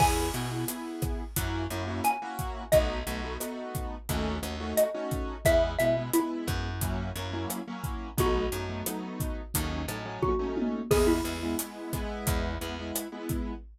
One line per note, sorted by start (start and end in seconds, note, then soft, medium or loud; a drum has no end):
0.00 0.31 E2 medium
0.00 0.27 B3 loud
0.00 0.27 E4 loud
0.00 0.27 G#4 loud
0.00 1.63 G#5 medium
0.00 kick loud
0.00 cross-stick loud
0.00 crash loud
0.34 0.65 B2 medium
0.34 0.48 B3 medium
0.34 0.48 E4 loud
0.34 0.48 G#4 medium
0.34 closed hi-hat medium
0.51 0.65 B3 medium
0.51 0.65 E4 medium
0.51 0.65 G#4 medium
0.68 1.22 B3 medium
0.68 1.22 E4 medium
0.68 1.22 G#4 medium
0.68 closed hi-hat loud
1.02 kick loud
1.02 cross-stick loud
1.02 closed hi-hat medium
1.36 1.67 F#2 medium
1.36 1.64 A#3 loud
1.36 1.64 C#4 loud
1.36 1.64 E4 loud
1.36 1.64 F#4 loud
1.36 kick medium
1.36 closed hi-hat loud
1.70 2.01 F#2 medium
1.70 1.85 A#3 medium
1.70 1.85 C#4 medium
1.70 1.85 E4 medium
1.70 1.85 F#4 medium
1.70 closed hi-hat medium
1.87 2.15 A#3 medium
1.87 2.15 C#4 medium
1.87 2.15 E4 medium
1.87 2.15 F#4 medium
2.04 2.64 G#5 medium
2.04 cross-stick medium
2.04 closed hi-hat loud
2.22 2.63 A#3 loud
2.22 2.63 C#4 medium
2.22 2.63 E4 medium
2.22 2.63 F#4 loud
2.39 kick medium
2.39 closed hi-hat medium
2.72 3.04 B1 medium
2.72 2.99 A3 loud
2.72 2.99 B3 loud
2.72 2.99 D#4 loud
2.72 2.99 F#4 loud
2.72 4.64 D#5 medium
2.72 kick loud
2.72 closed hi-hat loud
3.07 3.37 B1 medium
3.07 3.20 A3 medium
3.07 3.20 B3 loud
3.07 3.20 D#4 medium
3.07 3.20 F#4 loud
3.07 closed hi-hat medium
3.24 3.37 A3 medium
3.24 3.37 B3 loud
3.24 3.37 D#4 medium
3.24 3.37 F#4 medium
3.40 3.95 A3 medium
3.40 3.95 B3 medium
3.40 3.95 D#4 medium
3.40 3.95 F#4 medium
3.40 cross-stick loud
3.40 closed hi-hat loud
3.75 kick medium
3.75 closed hi-hat medium
4.09 4.40 D#2 medium
4.09 4.37 A3 loud
4.09 4.37 C#4 loud
4.09 4.37 D#4 loud
4.09 4.37 F#4 loud
4.09 kick medium
4.09 closed hi-hat loud
4.42 4.73 D#2 medium
4.42 4.56 A3 medium
4.42 4.56 C#4 medium
4.42 4.56 D#4 medium
4.42 4.56 F#4 medium
4.42 cross-stick loud
4.42 closed hi-hat medium
4.60 4.87 A3 loud
4.60 4.87 C#4 medium
4.60 4.87 D#4 medium
4.60 4.87 F#4 loud
4.77 5.40 D#5 medium
4.77 closed hi-hat loud
4.94 5.35 A3 medium
4.94 5.35 C#4 loud
4.94 5.35 D#4 medium
4.94 5.35 F#4 medium
5.11 kick medium
5.11 closed hi-hat medium
5.45 5.77 E2 medium
5.45 5.72 G#3 loud
5.45 5.72 B3 loud
5.45 5.72 E4 loud
5.45 5.62 E5 loud
5.45 kick loud
5.45 cross-stick loud
5.45 closed hi-hat loud
5.79 6.11 B2 medium
5.79 5.93 G#3 medium
5.79 5.93 B3 medium
5.79 5.93 E4 medium
5.79 5.95 E5 medium
5.79 closed hi-hat medium
5.97 6.11 G#3 medium
5.97 6.11 B3 medium
5.97 6.11 E4 medium
6.13 6.68 G#3 medium
6.13 6.68 B3 medium
6.13 6.96 E4 medium
6.13 6.68 E4 loud
6.13 closed hi-hat loud
6.47 7.12 F#2 loud
6.47 kick medium
6.47 cross-stick loud
6.47 closed hi-hat medium
6.81 7.10 F#3 loud
6.81 7.10 A#3 loud
6.81 7.10 C#4 loud
6.81 7.10 E4 loud
6.81 kick medium
6.81 closed hi-hat loud
7.15 7.46 F#2 medium
7.15 7.30 F#3 medium
7.15 7.30 A#3 loud
7.15 7.30 C#4 medium
7.15 7.30 E4 medium
7.15 closed hi-hat medium
7.33 7.60 F#3 loud
7.33 7.60 A#3 loud
7.33 7.60 C#4 medium
7.33 7.60 E4 medium
7.50 cross-stick medium
7.50 closed hi-hat loud
7.67 8.08 F#3 medium
7.67 8.08 A#3 loud
7.67 8.08 C#4 loud
7.67 8.08 E4 medium
7.84 kick medium
7.84 closed hi-hat medium
8.17 8.49 B1 medium
8.17 8.45 F#3 loud
8.17 8.45 A3 loud
8.17 8.45 B3 loud
8.17 8.45 D#4 loud
8.17 10.03 F#4 medium
8.17 kick loud
8.17 closed hi-hat loud
8.52 8.83 F#2 medium
8.52 8.66 F#3 medium
8.52 8.66 A3 medium
8.52 8.66 B3 medium
8.52 8.66 D#4 medium
8.52 closed hi-hat medium
8.69 8.83 F#3 medium
8.69 8.83 A3 medium
8.69 8.83 B3 medium
8.69 8.83 D#4 medium
8.86 9.41 F#3 medium
8.86 9.41 A3 medium
8.86 9.41 B3 medium
8.86 9.41 D#4 loud
8.86 cross-stick loud
8.86 closed hi-hat loud
9.20 kick medium
9.20 closed hi-hat medium
9.54 9.86 D#2 medium
9.54 9.82 F#3 medium
9.54 9.82 A3 loud
9.54 9.82 C#4 loud
9.54 9.82 D#4 loud
9.54 kick medium
9.54 closed hi-hat loud
9.88 10.19 A2 medium
9.88 10.03 F#3 medium
9.88 10.03 A3 medium
9.88 10.03 C#4 medium
9.88 10.03 D#4 medium
9.88 cross-stick loud
9.88 closed hi-hat medium
10.05 10.33 F#3 loud
10.05 10.33 A3 medium
10.05 10.33 C#4 loud
10.05 10.33 D#4 loud
10.22 10.83 F#4 medium
10.22 kick medium
10.22 high tom medium
10.39 10.80 F#3 medium
10.39 10.80 A3 loud
10.39 10.80 C#4 loud
10.39 10.80 D#4 medium
10.57 high tom loud
10.91 11.22 E2 medium
10.91 11.18 G#3 loud
10.91 11.18 B3 loud
10.91 11.18 E4 loud
10.91 11.07 G#4 medium
10.91 kick loud
10.91 cross-stick loud
10.91 crash loud
11.07 11.84 E4 medium
11.24 11.55 E2 medium
11.24 11.38 G#3 medium
11.24 11.38 B3 medium
11.24 11.38 E4 medium
11.24 closed hi-hat medium
11.43 11.56 G#3 medium
11.43 11.56 B3 medium
11.43 11.56 E4 loud
11.59 11.92 G#3 medium
11.59 11.92 B3 medium
11.59 11.92 E4 medium
11.59 closed hi-hat loud
11.93 12.55 G#3 loud
11.93 12.55 B3 loud
11.93 12.55 E4 loud
11.93 kick medium
11.93 cross-stick medium
11.93 closed hi-hat medium
12.27 12.58 E2 loud
12.27 kick loud
12.27 closed hi-hat loud
12.61 12.92 E2 medium
12.61 12.74 G#3 medium
12.61 12.74 B3 loud
12.61 12.74 E4 medium
12.61 closed hi-hat medium
12.79 13.06 G#3 medium
12.79 13.06 B3 medium
12.79 13.06 E4 loud
12.95 cross-stick loud
12.95 closed hi-hat loud
13.12 13.53 G#3 loud
13.12 13.53 B3 loud
13.12 13.53 E4 medium
13.29 kick medium
13.29 closed hi-hat medium